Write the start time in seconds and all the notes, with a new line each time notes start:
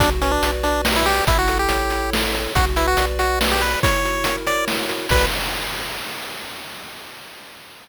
0.00 B1 D4 F#4, kick, closed hi-hat
0.21 C#4 B4, closed hi-hat
0.31 D4
0.42 B1 D5, closed hi-hat
0.63 D4 F#4, closed hi-hat
0.85 B4, snare
0.96 E4
1.06 G4 D5, open hi-hat
1.27 A1 E4, kick, closed hi-hat
1.39 F#4
1.48 A4, closed hi-hat
1.59 G4
1.69 A1 C#5, closed hi-hat
1.90 E4, closed hi-hat
2.13 A4, snare
2.34 C#5, closed hi-hat
2.55 B1 F#4, kick, closed hi-hat
2.76 E4 B4, closed hi-hat
2.88 F#4
2.97 B1 D5, closed hi-hat
3.19 F#4, closed hi-hat
3.41 B4, snare
3.52 G4
3.61 B4 D5, closed hi-hat
3.83 E4 C#5, kick, closed hi-hat
4.04 F#4, closed hi-hat
4.24 A#4, closed hi-hat
4.47 C#5 D5, closed hi-hat
4.68 E4, snare
4.89 F#4, closed hi-hat
5.09 B1 F#4 B4 D5, kick, crash